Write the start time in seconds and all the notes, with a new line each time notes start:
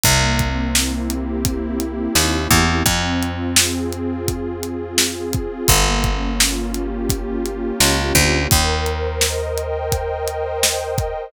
0.04 C2 A#3, kick, closed hi-hat
0.39 C4, kick, closed hi-hat
0.74 E4, snare
1.09 G4, closed hi-hat
1.45 E4, kick, closed hi-hat
1.80 C4, closed hi-hat
2.15 D#2 A#3, snare
2.51 E2 C4, kick, closed hi-hat
2.86 F2 C4, kick, closed hi-hat
3.21 F4, closed hi-hat
3.56 G#4, snare
3.92 F4, closed hi-hat
4.28 C4, kick, closed hi-hat
4.62 F4, closed hi-hat
4.98 G#4, snare
5.33 F4, kick, closed hi-hat
5.68 G1 A#3, kick, closed hi-hat
6.04 C#4, kick, closed hi-hat
6.39 F4, snare
6.74 G4, closed hi-hat
7.09 F4, kick, closed hi-hat
7.45 C#4, closed hi-hat
7.80 C#2 A#3, snare
8.15 D2 C#4, kick, closed hi-hat
8.51 D#2 A#4, kick, closed hi-hat
8.86 C5, closed hi-hat
9.21 D#5, snare
9.57 G5, closed hi-hat
9.91 D#5, kick, closed hi-hat
10.28 C5, closed hi-hat
10.63 A#4, snare
10.98 C5, kick, closed hi-hat